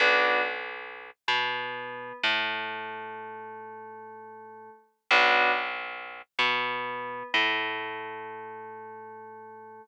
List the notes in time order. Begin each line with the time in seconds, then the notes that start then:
0.00 B1 B3 D4 F#4
1.28 B2 B3
2.23 A2 A3
5.11 B1 B3 D4 F#4
6.39 B2 B3
7.34 A2 A3